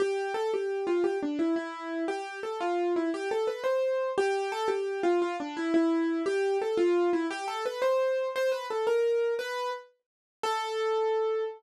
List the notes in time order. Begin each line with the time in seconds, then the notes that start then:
0.00 G4
0.34 A4
0.54 G4
0.87 F4
1.04 G4
1.23 D4
1.39 E4
1.56 E4
2.08 G4
2.43 A4
2.61 F4
2.96 E4
3.14 G4
3.31 A4
3.47 B4
3.64 C5
4.18 G4
4.52 A4
4.68 G4
5.03 F4
5.22 F4
5.40 D4
5.57 E4
5.74 E4
6.26 G4
6.62 A4
6.77 F4
7.13 E4
7.31 G4
7.48 A4
7.66 B4
7.82 C5
8.36 C5
8.52 B4
8.70 A4
8.87 A#4
9.39 B4
10.43 A4